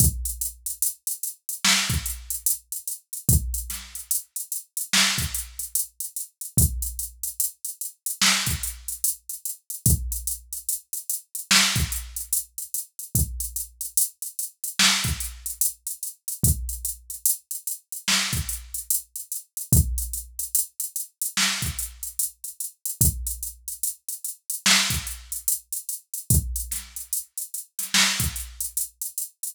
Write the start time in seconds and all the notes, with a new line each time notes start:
0.00 kick, closed hi-hat
0.25 closed hi-hat
0.41 closed hi-hat
0.66 closed hi-hat
0.82 closed hi-hat
1.07 closed hi-hat
1.23 closed hi-hat
1.49 closed hi-hat
1.65 snare
1.90 kick, closed hi-hat
2.06 closed hi-hat
2.30 closed hi-hat
2.46 closed hi-hat
2.72 closed hi-hat
2.88 closed hi-hat
3.13 closed hi-hat
3.29 kick, closed hi-hat
3.54 closed hi-hat
3.70 snare, closed hi-hat
3.95 closed hi-hat
4.11 closed hi-hat
4.36 closed hi-hat
4.52 closed hi-hat
4.77 closed hi-hat
4.93 snare
5.18 kick, closed hi-hat
5.34 closed hi-hat
5.59 closed hi-hat
5.75 closed hi-hat
6.00 closed hi-hat
6.16 closed hi-hat
6.41 closed hi-hat
6.57 kick, closed hi-hat
6.82 closed hi-hat
6.99 closed hi-hat
7.23 closed hi-hat
7.40 closed hi-hat
7.65 closed hi-hat
7.81 closed hi-hat
8.06 closed hi-hat
8.22 snare
8.46 kick, closed hi-hat
8.63 closed hi-hat
8.88 closed hi-hat
9.04 closed hi-hat
9.29 closed hi-hat
9.45 closed hi-hat
9.70 closed hi-hat
9.86 kick, closed hi-hat
10.12 closed hi-hat
10.27 closed hi-hat
10.53 closed hi-hat
10.69 closed hi-hat
10.93 closed hi-hat
11.09 closed hi-hat
11.35 closed hi-hat
11.51 snare
11.76 kick, closed hi-hat
11.92 closed hi-hat
12.16 closed hi-hat
12.33 closed hi-hat
12.58 closed hi-hat
12.74 closed hi-hat
12.99 closed hi-hat
13.15 kick, closed hi-hat
13.40 closed hi-hat
13.56 closed hi-hat
13.81 closed hi-hat
13.97 closed hi-hat
14.22 closed hi-hat
14.39 closed hi-hat
14.64 closed hi-hat
14.79 snare
15.04 kick, closed hi-hat
15.20 closed hi-hat
15.46 closed hi-hat
15.61 closed hi-hat
15.87 closed hi-hat
16.03 closed hi-hat
16.28 closed hi-hat
16.43 kick, closed hi-hat
16.69 closed hi-hat
16.85 closed hi-hat
17.10 closed hi-hat
17.26 closed hi-hat
17.51 closed hi-hat
17.67 closed hi-hat
17.92 closed hi-hat
18.08 snare
18.33 kick, closed hi-hat
18.49 closed hi-hat
18.74 closed hi-hat
18.90 closed hi-hat
19.16 closed hi-hat
19.32 closed hi-hat
19.57 closed hi-hat
19.72 kick, closed hi-hat
19.98 closed hi-hat
20.13 closed hi-hat
20.39 closed hi-hat
20.55 closed hi-hat
20.80 closed hi-hat
20.96 closed hi-hat
21.21 closed hi-hat
21.37 snare
21.62 kick, closed hi-hat
21.79 closed hi-hat
22.03 closed hi-hat
22.19 closed hi-hat
22.44 closed hi-hat
22.60 closed hi-hat
22.85 closed hi-hat
23.01 kick, closed hi-hat
23.27 closed hi-hat
23.43 closed hi-hat
23.68 closed hi-hat
23.83 closed hi-hat
24.09 closed hi-hat
24.24 closed hi-hat
24.50 closed hi-hat
24.66 snare
24.90 kick, closed hi-hat
25.07 closed hi-hat
25.32 closed hi-hat
25.48 closed hi-hat
25.72 closed hi-hat
25.89 closed hi-hat
26.14 closed hi-hat
26.30 kick, closed hi-hat
26.56 closed hi-hat
26.71 snare, closed hi-hat
26.96 closed hi-hat
27.13 closed hi-hat
27.38 closed hi-hat
27.54 closed hi-hat
27.79 snare, closed hi-hat
27.94 snare
28.20 kick, closed hi-hat
28.36 closed hi-hat
28.60 closed hi-hat
28.77 closed hi-hat
29.02 closed hi-hat
29.18 closed hi-hat
29.43 closed hi-hat